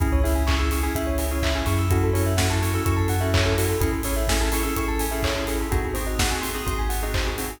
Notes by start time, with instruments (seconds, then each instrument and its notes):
0.00 synth bass 2 C#2, electric piano 2 C#4 E4 G#4, tubular bells G#4, kick, closed hi-hat
0.12 tubular bells C#5
0.24 electric piano 2 C#4 E4 G#4, tubular bells E5, open hi-hat
0.35 tubular bells G#5
0.47 electric piano 2 C#4 E4 G#4, tubular bells C#6, kick, clap
0.58 electric piano 2 C#4 E4 G#4, tubular bells E6
0.71 electric piano 2 C#4 E4 G#4, tubular bells C#6, open hi-hat
0.83 electric piano 2 C#4 E4 G#4, tubular bells G#5
0.95 synth bass 2 C#2, electric piano 2 C#4 E4 G#4, tubular bells E5, kick, closed hi-hat
1.07 tubular bells C#5
1.18 tubular bells G#4, open hi-hat
1.31 electric piano 2 C#4 E4 G#4, tubular bells C#5
1.43 tubular bells E5, kick, clap
1.55 electric piano 2 C#4 E4 G#4, tubular bells G#5
1.66 synth bass 2 F#2, electric piano 2 C#4 E4 G#4, tubular bells C#6, open hi-hat
1.79 tubular bells E6
1.90 electric piano 2 C#4 E4 F#4 A4, tubular bells F#4, kick, closed hi-hat
2.03 tubular bells A4
2.13 electric piano 2 C#4 E4 F#4 A4, tubular bells C#5, open hi-hat
2.26 tubular bells E5
2.37 electric piano 2 C#4 E4 F#4 A4, tubular bells F#5, kick, snare
2.50 electric piano 2 C#4 E4 F#4 A4, tubular bells A5
2.62 electric piano 2 C#4 E4 F#4 A4, tubular bells C#6, open hi-hat
2.74 electric piano 2 C#4 E4 F#4 A4, tubular bells E6
2.85 synth bass 2 F#2, electric piano 2 C#4 E4 F#4 A4, tubular bells C#6, kick, closed hi-hat
2.97 tubular bells A5
3.08 tubular bells F#5, open hi-hat
3.20 electric piano 2 C#4 E4 F#4 A4, tubular bells E5
3.34 tubular bells C#5, kick, clap
3.45 electric piano 2 C#4 E4 F#4 A4, tubular bells A4
3.57 electric piano 2 C#4 E4 F#4 A4, tubular bells F#4, open hi-hat
3.69 tubular bells A4
3.80 synth bass 2 A1, electric piano 2 C#4 E4 G#4 A4, tubular bells G#4, kick, closed hi-hat
3.92 tubular bells A4
4.03 electric piano 2 C#4 E4 G#4 A4, tubular bells C#5, open hi-hat
4.16 tubular bells E5
4.28 electric piano 2 C#4 E4 G#4 A4, tubular bells G#5, kick, snare
4.40 electric piano 2 C#4 E4 G#4 A4, tubular bells A5
4.52 electric piano 2 C#4 E4 G#4 A4, tubular bells C#6, open hi-hat
4.63 electric piano 2 C#4 E4 G#4 A4, tubular bells E6
4.76 synth bass 2 A1, electric piano 2 C#4 E4 G#4 A4, tubular bells C#6, kick, closed hi-hat
4.88 tubular bells A5
4.99 tubular bells G#5, open hi-hat
5.11 electric piano 2 C#4 E4 G#4 A4, tubular bells E5
5.23 tubular bells C#5, kick, clap
5.36 electric piano 2 C#4 E4 G#4 A4, tubular bells A4
5.47 electric piano 2 C#4 E4 G#4 A4, tubular bells G#4, open hi-hat
5.60 tubular bells A4
5.71 synth bass 2 G#1, electric piano 2 C4 D#4 F#4 G#4, tubular bells F#4, kick, closed hi-hat
5.85 tubular bells G#4
5.94 electric piano 2 C4 D#4 F#4 G#4, tubular bells C5, open hi-hat
6.07 tubular bells D#5
6.19 electric piano 2 C4 D#4 F#4 G#4, tubular bells F#5, kick, snare
6.31 electric piano 2 C4 D#4 F#4 G#4, tubular bells G#5
6.41 electric piano 2 C4 D#4 F#4 G#4, tubular bells C6, open hi-hat
6.55 electric piano 2 C4 D#4 F#4 G#4, tubular bells D#6
6.66 synth bass 2 G#1, electric piano 2 C4 D#4 F#4 G#4, tubular bells C6, kick, closed hi-hat
6.79 tubular bells G#5
6.89 tubular bells F#5, open hi-hat
7.02 electric piano 2 C4 D#4 F#4 G#4, tubular bells D#5
7.14 tubular bells C5, kick, clap
7.26 electric piano 2 C4 D#4 F#4 G#4, tubular bells G#4
7.37 electric piano 2 C4 D#4 F#4 G#4, tubular bells F#4, open hi-hat
7.50 tubular bells G#4